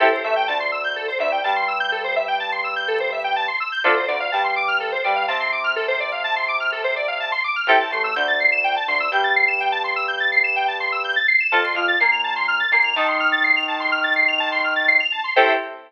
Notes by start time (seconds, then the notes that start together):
0.00 A1 C4 E4 G4 A4
0.12 C5
0.24 A1 A3 E5
0.36 G5
0.48 D2 D3 A5
0.60 C6
0.72 E6
0.84 G6
0.96 A4
1.08 C5
1.19 D2 D3 E5
1.32 G5
1.44 G2 G3 A5
1.56 C6
1.68 E6
1.80 G6
1.92 A4
2.04 C5
2.16 E5
2.28 G5
2.40 A5
2.52 C6
2.64 E6
2.76 G6
2.88 A4
3.00 C5
3.12 E5
3.24 G5
3.36 A5
3.48 C6
3.60 E6
3.72 G6
3.84 D2 C4 D4 F4 A4
3.96 C5
4.08 D2 D3 D5
4.20 F5
4.32 G2 G3 A5
4.44 C6
4.56 D6
4.68 F6
4.80 A4
4.92 C5
5.04 G2 G3 D5
5.16 F5
5.28 C3 C4 A5
5.40 C6
5.52 D6
5.64 F6
5.76 A4
5.88 C5
6.00 D5
6.12 F5
6.24 A5
6.36 C6
6.48 D6
6.60 F6
6.72 A4
6.84 C5
6.96 D5
7.08 F5
7.20 A5
7.32 C6
7.44 D6
7.56 F6
7.67 A1 C4 E4 G4 A4 G5
7.80 A5
7.91 A1 A3 C6
8.04 E6
8.16 D2 D3 G6
8.28 A6
8.40 C7
8.52 E7
8.64 G5
8.76 A5
8.88 D2 D3 C6
9.00 E6
9.12 G2 G3 G6
9.24 A6
9.36 C7
9.48 E7
9.60 G5
9.72 A5
9.84 C6
9.96 E6
10.08 G6
10.20 A6
10.32 C7
10.44 E7
10.56 G5
10.68 A5
10.80 C6
10.92 E6
11.04 G6
11.16 A6
11.28 C7
11.40 E7
11.52 F2 C4 F4 A4 A5
11.64 C6
11.75 F2 F3 F6
11.88 A6
12.00 A#2 A#3 C7
12.12 F7
12.24 A5
12.36 C6
12.48 F6
12.60 A6
12.72 A#2 A#3 C7
12.84 F7
12.96 D#3 D#4 A5
13.08 C6
13.20 F6
13.32 A6
13.44 C7
13.56 F7
13.68 A5
13.80 C6
13.92 F6
14.04 A6
14.16 C7
14.28 F7
14.40 A5
14.52 C6
14.64 F6
14.76 A6
14.88 C7
15.00 F7
15.12 A5
15.24 C6
15.36 A2 C4 E4 G4 A4 C5 E5 G5